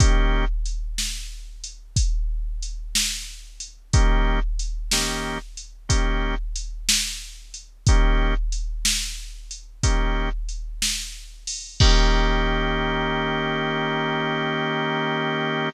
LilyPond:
<<
  \new Staff \with { instrumentName = "Drawbar Organ" } { \time 12/8 \key ees \major \tempo 4. = 61 <ees bes des' g'>1. | <ees bes des' g'>4. <ees bes des' g'>4. <ees bes des' g'>2. | <ees bes des' g'>2. <ees bes des' g'>2. | <ees bes des' g'>1. | }
  \new DrumStaff \with { instrumentName = "Drums" } \drummode { \time 12/8 <hh bd>4 hh8 sn4 hh8 <hh bd>4 hh8 sn4 hh8 | <hh bd>4 hh8 sn4 hh8 <hh bd>4 hh8 sn4 hh8 | <hh bd>4 hh8 sn4 hh8 <hh bd>4 hh8 sn4 hho8 | <cymc bd>4. r4. r4. r4. | }
>>